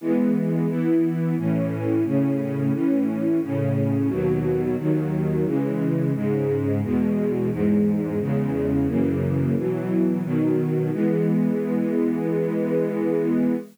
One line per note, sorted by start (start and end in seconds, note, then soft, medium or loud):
0.01 0.67 E3 medium
0.01 0.68 G#3 medium
0.01 0.67 B3 medium
0.68 1.35 E3 medium
0.68 1.35 B3 medium
0.68 1.35 E4 medium
1.37 2.04 A2 medium
1.37 2.04 E3 medium
1.37 2.04 C#4 medium
2.05 2.72 A2 medium
2.05 2.72 C#3 medium
2.05 2.72 C#4 medium
2.73 3.40 A2 medium
2.73 3.40 E3 medium
2.73 3.40 C#4 medium
3.42 4.10 A2 medium
3.42 4.10 C#3 medium
3.42 4.10 C#4 medium
4.09 4.76 D#2 medium
4.09 4.76 B2 medium
4.09 4.76 F#3 loud
4.78 5.45 D#2 medium
4.78 5.45 D#3 medium
4.78 5.45 F#3 medium
5.45 6.13 C#3 medium
5.45 6.13 E3 medium
5.45 6.13 G#3 medium
6.14 6.81 G#2 medium
6.14 6.81 C#3 medium
6.14 6.81 G#3 medium
6.83 7.50 E2 medium
6.83 7.50 B2 medium
6.83 7.50 G#3 medium
7.51 8.18 E2 medium
7.51 8.18 G#2 medium
7.51 8.18 G#3 medium
8.19 8.87 E2 medium
8.19 8.87 C#3 medium
8.19 8.87 G#3 medium
8.87 9.55 F#2 medium
8.87 9.55 C#3 medium
8.87 9.55 E3 medium
8.87 9.55 A#3 medium
9.56 10.22 B2 medium
9.56 10.23 E3 medium
9.56 10.22 F#3 medium
10.23 10.90 B2 medium
10.23 10.90 D#3 medium
10.23 10.90 F#3 medium
10.92 13.55 E3 medium
10.92 13.55 G#3 medium
10.92 13.55 B3 medium